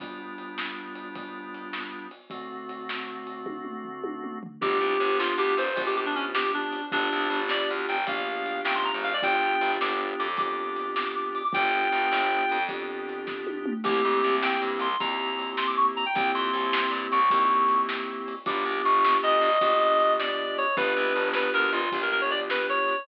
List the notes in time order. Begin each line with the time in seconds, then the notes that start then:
0.00 G3 B3 D4 F4, kick, ride
0.38 ride
0.58 snare
0.95 ride
1.15 kick, ride
1.54 ride
1.73 snare
2.11 ride
2.30 D3 A3 C4 F#4, kick, ride
2.69 ride
2.89 snare
3.27 ride
3.46 kick, high tom
3.65 mid tom
3.84 floor tom
4.04 high tom
4.24 mid tom
4.43 floor tom
4.61 G1 B3 D4 F4 G4, kick, crash
4.80 C2
5.00 G1, ride
5.19 F4, snare
5.38 D2 G4
5.57 G1 C5, ride
5.76 A#1 B3 D4 F4 G4, kick, ride
5.86 G4
5.96 G4
6.06 D4
6.15 C#4, ride
6.35 G4, snare
6.54 D4
6.72 ride
6.92 G1 B3 D4 F4 G4, kick, ride
7.12 C2
7.30 G1, ride
7.49 D5, snare
7.70 D2
7.88 G1 G5, ride
8.07 A#1 B3 D4 F4 G4 F5, kick, ride
8.46 ride
8.65 A1 G5, snare
8.75 C6
8.85 A#5
8.94 G#1
9.04 F5, ride
9.13 D5
9.22 G1 B3 D4 F4 G4 G5, kick, ride
9.61 G1, ride
9.81 G1 D6, snare
10.19 F2 D6, ride
10.37 B3 D4 F4 G4 D6, kick, ride
10.76 ride
10.96 D6, snare
11.06 D6
11.15 D6
11.35 D6, ride
11.44 D6
11.53 G1 B3 D4 F4 G4 G5, kick, ride
11.92 G1, ride
12.11 G1, snare
12.49 F2, ride
12.69 B3 D4 F4 G4, kick, ride
13.09 ride
13.27 kick, snare
13.47 high tom
13.66 mid tom
13.84 C2 A#3 C4 E4 G4, kick, crash
14.05 F2
14.23 C2, ride
14.42 G5, snare
14.62 G2
14.79 C2 C6, ride
15.00 D#2 A#3 C4 E4 G4 A#5, kick, ride
15.39 ride
15.57 C6, snare
15.67 D6
15.77 C#6
15.96 A#5, ride
16.06 G5
16.15 C2 A#3 C4 E4 G4 G5, kick, ride
16.35 F2 C6
16.53 C2, ride
16.73 snare
16.91 G2
17.11 C2 C#6, ride
17.30 D#2 A#3 C4 E4 G4, kick, ride
17.68 ride
17.89 snare
18.28 ride
18.46 G1 B3 D4 F4 G4 D6, kick, ride
18.65 C2
18.84 G1 C#6, ride
19.04 snare
19.23 D2 D#5
19.41 G1, ride
19.61 A#1 B3 D4 F4 G4, kick, ride
20.00 ride
20.19 D5, snare
20.58 C#5, ride
20.77 G1 B3 D4 F4 G4 B4, kick, ride
20.97 C2
21.16 G1, ride
21.33 B4, snare
21.54 D2 A#4
21.73 G1 F4, ride
21.92 A#1 B3 D4 F4 G4, kick, ride
22.02 A#4
22.12 A#4
22.21 C#5
22.31 D5, ride
22.50 B4, snare
22.69 C#5
22.88 ride